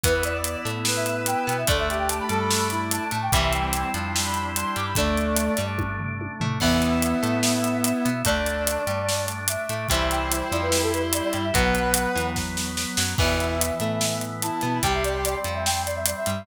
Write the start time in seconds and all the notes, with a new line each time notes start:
0.04 E2 E3 B3 E4 B4, kick, closed hi-hat
0.14 B4
0.23 D5, closed hi-hat
0.34 D5
0.44 closed hi-hat
0.65 A2 A3, closed hi-hat
0.85 B4, snare
0.96 E5
1.06 E5, closed hi-hat
1.26 G5, closed hi-hat
1.47 B2 B3 G5, closed hi-hat
1.58 E5
1.67 D2 D3 A3 D4 A4 D5, kick, closed hi-hat
1.78 E5
1.89 G4 E5, closed hi-hat
1.99 G5
2.09 A5, closed hi-hat
2.19 B5
2.29 G2 G3 A4 A5, closed hi-hat
2.40 B5
2.51 snare
2.70 E4, closed hi-hat
2.91 A5, closed hi-hat
3.11 A2 A3 A5, closed hi-hat
3.22 G5
3.32 C2 C3 E3 G3 C4 E4 E5, kick, closed hi-hat
3.43 E5
3.53 G5, closed hi-hat
3.73 closed hi-hat
3.93 F2 F3 D4, closed hi-hat
4.15 G3 E4 G4, snare
4.25 B5
4.34 B5, closed hi-hat
4.54 D4 C6, closed hi-hat
4.76 G2 G3 D6, closed hi-hat
4.87 B5
4.95 D2 D3 A3 D4 D5, kick, closed hi-hat
5.17 closed hi-hat
5.37 closed hi-hat
5.57 G2 G3, closed hi-hat
5.78 kick, high tom
5.99 floor tom
6.21 high tom
6.40 A2 A3, floor tom
6.60 E2 E3 B3 E4 E5, kick, crash
6.82 closed hi-hat
7.02 closed hi-hat
7.23 A2 A3, closed hi-hat
7.43 snare
7.64 closed hi-hat
7.84 E5, closed hi-hat
8.05 B2 B3, closed hi-hat
8.25 D2 D3 A3 D4 D5, kick, closed hi-hat
8.46 closed hi-hat
8.67 closed hi-hat
8.87 G2 G3, closed hi-hat
9.09 snare
9.28 closed hi-hat
9.48 E5, closed hi-hat
9.69 A2 A3, closed hi-hat
9.89 C2 C3 E3 G3 C4 E4 E5, kick, closed hi-hat
10.11 G5, closed hi-hat
10.31 C5, closed hi-hat
10.52 F2 F3 D5, closed hi-hat
10.62 B4
10.72 G3 E4 G4, snare
10.82 A4
10.93 B4, closed hi-hat
11.13 D5, closed hi-hat
11.24 D5
11.33 G2 G3, closed hi-hat
11.44 E5
11.53 B1 B2 F#3 B3 B4 F#5, kick, closed hi-hat
11.75 closed hi-hat
11.94 closed hi-hat
12.15 E2 E3, closed hi-hat
12.36 kick, snare
12.57 snare
12.77 snare
12.97 F#2 F#3, snare
13.18 E2 B2 E3 B3 E4 E5, kick, crash
13.40 closed hi-hat
13.61 closed hi-hat
13.80 A2 A3, closed hi-hat
14.01 snare
14.21 closed hi-hat
14.42 E4 A5, closed hi-hat
14.61 B2 B3, closed hi-hat
14.83 C2 C3 G3 C4 G4 G5, kick, closed hi-hat
14.93 E5
15.04 D5, closed hi-hat
15.24 D5, closed hi-hat
15.34 D5
15.44 F2 F3, closed hi-hat
15.55 E5
15.65 G5, snare
15.86 D5, closed hi-hat
15.96 E5
16.06 D5, closed hi-hat
16.17 E5
16.26 G2 G3, closed hi-hat